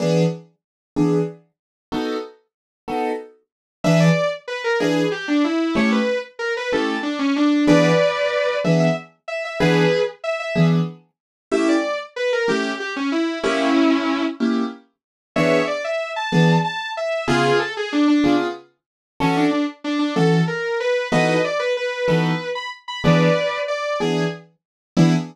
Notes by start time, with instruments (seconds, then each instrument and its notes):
0.00 acoustic grand piano E3 B3 D4 G#4
0.96 acoustic grand piano E3 B3 D4 G#4
1.92 acoustic grand piano B3 D#4 F#4 A4
2.88 acoustic grand piano B3 D#4 F#4 A4
3.84 acoustic grand piano E3 D4 G#4 B4, distortion guitar E5
4.00 distortion guitar D5
4.48 distortion guitar B4
4.64 distortion guitar A#4
4.80 acoustic grand piano E3 D4 G#4 B4, distortion guitar G#4
5.12 distortion guitar G4
5.28 distortion guitar D4
5.44 distortion guitar E4
5.75 acoustic grand piano A3 C#4 E4 G4, distortion guitar C#5
5.92 distortion guitar B4
6.39 distortion guitar A#4
6.57 distortion guitar B4
6.72 acoustic grand piano A3 C#4 E4 G4, distortion guitar A4
7.03 distortion guitar D4
7.19 distortion guitar C#4
7.36 distortion guitar D4
7.67 acoustic grand piano E3 B3 D4 G#4, distortion guitar B4 D5
8.64 acoustic grand piano E3 B3 D4 G#4, distortion guitar E5
8.80 distortion guitar E5
9.28 distortion guitar E5
9.45 distortion guitar E5
9.60 acoustic grand piano E3 B3 D4 G#4, distortion guitar G#4 B4
10.24 distortion guitar E5
10.40 distortion guitar E5
10.55 acoustic grand piano E3 B3 D4 G#4
11.52 acoustic grand piano A3 C#4 E4 G4, distortion guitar E5
11.69 distortion guitar D5
12.16 distortion guitar B4
12.33 distortion guitar A#4
12.48 acoustic grand piano A3 C#4 E4 G4, distortion guitar G4
12.80 distortion guitar G4
12.96 distortion guitar C#4
13.12 distortion guitar E4
13.43 acoustic grand piano A#3 C#4 E4 G4, distortion guitar C#4 E4
14.40 acoustic grand piano A#3 C#4 E4 G4
15.36 acoustic grand piano E3 B3 D4 G#4, distortion guitar C#5 E5
15.67 distortion guitar D5
15.84 distortion guitar E5
16.16 distortion guitar A5
16.32 acoustic grand piano E3 B3 D4 G#4
16.64 distortion guitar A5
16.97 distortion guitar E5
17.28 acoustic grand piano C#3 B3 F4 G#4, distortion guitar F4 G#4
17.59 distortion guitar A4
17.77 distortion guitar G#4
17.92 distortion guitar D4
18.08 distortion guitar D4
18.24 acoustic grand piano C#3 B3 F4 G#4
19.20 acoustic grand piano E3 C#4 F#4 A4, distortion guitar C#4
19.37 distortion guitar D4
19.51 distortion guitar D4
19.84 distortion guitar D4
19.99 distortion guitar D4
20.16 acoustic grand piano E3 C#4 F#4 A4, distortion guitar A4
20.48 distortion guitar A#4
20.80 distortion guitar B4
21.12 acoustic grand piano E3 B3 D#4 F#4 A4, distortion guitar B4 D#5
21.44 distortion guitar D5
21.59 distortion guitar B4
21.77 distortion guitar B4
22.08 acoustic grand piano E3 B3 D#4 F#4 A4, distortion guitar B4
22.55 distortion guitar B5
22.88 distortion guitar B5
23.04 acoustic grand piano E3 B3 D4 G#4, distortion guitar B4 D5
23.68 distortion guitar D5
24.00 acoustic grand piano E3 B3 D4 G#4, distortion guitar G#4
24.97 acoustic grand piano E3 B3 D4 G#4, distortion guitar E4